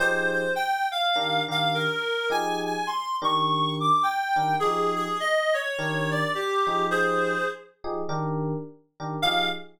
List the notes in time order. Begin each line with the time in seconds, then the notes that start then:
0.00 F3 D#4 G4 G#4 C5
0.32 C5
0.56 G5
0.91 F5
1.16 D#3 D4 G4 A#4
1.48 D#3 D4 G4 A#4 F5
1.74 A#4
2.30 F3 D#4 G4 G#4 G#5
2.65 G#5
2.87 C6
3.22 D#3 D4 G4 A#4 C#6
3.80 D6
4.03 G5
4.36 D#3 D4 G4 A#4
4.60 F3 D#4 G4 G#4
4.95 G#4
5.20 D#5
5.54 C#5
5.79 D#3 D4 G4 A#4
6.11 D5
6.35 G4
6.67 F3 D#4 G4 G#4
6.91 G#4 C5
7.84 F3 D#4 G4 G#4
8.09 D#3 D4 G4 A#4
9.00 D#3 D4 G4 A#4
9.22 F3 D#4 G4 G#4 F5